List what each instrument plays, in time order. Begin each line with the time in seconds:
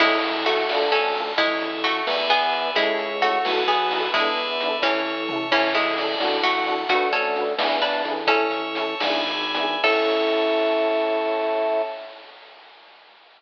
0.00 drawbar organ A1, harpsichord G#3 E4, electric piano 1 C#4 E4, tubular bells C#5, kick, crash
0.05 electric piano 1 A4
0.23 tubular bells E5, closed hi-hat
0.46 harpsichord A3 F#4, electric piano 1 C#4 E4, tubular bells A5, closed hi-hat
0.51 electric piano 1 A4
0.69 drawbar organ D2, electric piano 1 D4, tubular bells D5, snare
0.73 electric piano 1 F4 A4
0.92 harpsichord C#4 A4, tubular bells F5, closed hi-hat
1.15 electric piano 1 D4, tubular bells A5, closed hi-hat
1.19 electric piano 1 F4 A4
1.37 drawbar organ A1, harpsichord G#3 E4, tubular bells C#5, kick, closed hi-hat
1.60 tubular bells E5, closed hi-hat
1.83 harpsichord A3 F#4, tubular bells A5, closed hi-hat
2.07 drawbar organ E2, tubular bells B4 D5 E5 A5, snare
2.30 harpsichord B3 G#4, closed hi-hat
2.53 closed hi-hat
2.75 drawbar organ C#2, harpsichord G#3 E4, electric piano 1 C#4 E4, tubular bells C#5, kick, closed hi-hat
2.82 electric piano 1 A4
2.99 tubular bells E5, closed hi-hat
3.22 harpsichord A3 F#4, electric piano 1 C#4, tubular bells A5, closed hi-hat
3.26 electric piano 1 E4 A4
3.44 drawbar organ B1, electric piano 1 B3 E4, tubular bells B4 E5 F#5 A5, snare
3.50 electric piano 1 F#4 A4
3.68 harpsichord B3 G#4, closed hi-hat
3.90 electric piano 1 B3 E4, open hi-hat
3.95 electric piano 1 F#4 A4
4.12 drawbar organ E2, harpsichord G#3 E4, electric piano 1 B3 D4, tubular bells B4 D5 E5 A5, kick, closed hi-hat
4.18 electric piano 1 E4 A4
4.37 closed hi-hat
4.60 electric piano 1 B3 D4, closed hi-hat
4.66 electric piano 1 E4 A4
4.82 drawbar organ A1, harpsichord E3 C#4, electric piano 1 C#4 E4, tubular bells C#5, kick, snare
4.87 electric piano 1 A4
5.05 tubular bells E5
5.28 electric piano 1 C#4, tubular bells A5, floor tom
5.33 electric piano 1 E4 A4
5.51 drawbar organ A1, harpsichord E3 C#4, electric piano 1 C#4 E4, tubular bells C#5, kick, crash
5.56 electric piano 1 A4
5.75 harpsichord G#3 E4, tubular bells E5, closed hi-hat
5.98 electric piano 1 C#4 E4, tubular bells D5, closed hi-hat
6.03 electric piano 1 A4
6.20 drawbar organ A1, electric piano 1 D4 F#4, snare
6.25 electric piano 1 A4
6.43 harpsichord A3 F#4, tubular bells F#5, closed hi-hat
6.66 electric piano 1 D4 F#4, tubular bells A5, closed hi-hat
6.72 electric piano 1 A4
6.89 drawbar organ D2, harpsichord A3 F#4, electric piano 1 D4 F#4, kick, closed hi-hat
6.95 electric piano 1 B4
7.13 harpsichord C#4 A4, closed hi-hat
7.36 electric piano 1 D4 F#4, closed hi-hat
7.41 electric piano 1 B4
7.59 drawbar organ E2, electric piano 1 D4 E4, snare
7.65 electric piano 1 G#4 B4
7.82 harpsichord D4 B4, closed hi-hat
8.05 drawbar organ A1, electric piano 1 D4 E4, closed hi-hat
8.11 electric piano 1 G#4 B4
8.26 electric piano 1 C#4 E4, harpsichord C#4 A4, tubular bells C#5, kick, closed hi-hat
8.32 electric piano 1 A4
8.51 tubular bells E5, closed hi-hat
8.75 electric piano 1 C#4 E4, tubular bells A5, closed hi-hat
8.82 electric piano 1 A4
9.00 drawbar organ G#1, electric piano 1 B3, tubular bells B4 D5 E5 G#5, snare
9.04 electric piano 1 D4 E4
9.10 electric piano 1 G#4
9.27 closed hi-hat
9.54 electric piano 1 B3 D4, closed hi-hat
9.60 electric piano 1 E4 G#4
9.83 drawbar organ A2, electric piano 1 C#4 E4, harpsichord A4, tubular bells C#5 E5 A5, kick, crash
9.89 electric piano 1 A4